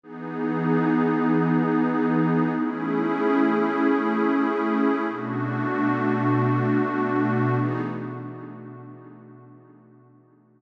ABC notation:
X:1
M:4/4
L:1/8
Q:1/4=95
K:Emix
V:1 name="Pad 2 (warm)"
[E,B,^DG]8 | [A,CEG]8 | [B,,A,DF]8 | [E,B,^DG]2 z6 |]